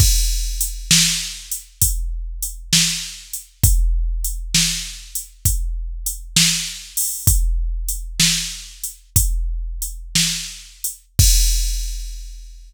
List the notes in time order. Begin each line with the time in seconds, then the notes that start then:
0.00 kick, crash
0.61 closed hi-hat
0.91 snare
1.52 closed hi-hat
1.82 kick, closed hi-hat
2.42 closed hi-hat
2.73 snare
3.33 closed hi-hat
3.64 kick, closed hi-hat
4.24 closed hi-hat
4.54 snare
5.15 closed hi-hat
5.45 kick, closed hi-hat
6.06 closed hi-hat
6.36 snare
6.97 open hi-hat
7.27 kick, closed hi-hat
7.88 closed hi-hat
8.20 snare
8.84 closed hi-hat
9.16 kick, closed hi-hat
9.82 closed hi-hat
10.15 snare
10.84 closed hi-hat
11.19 kick, crash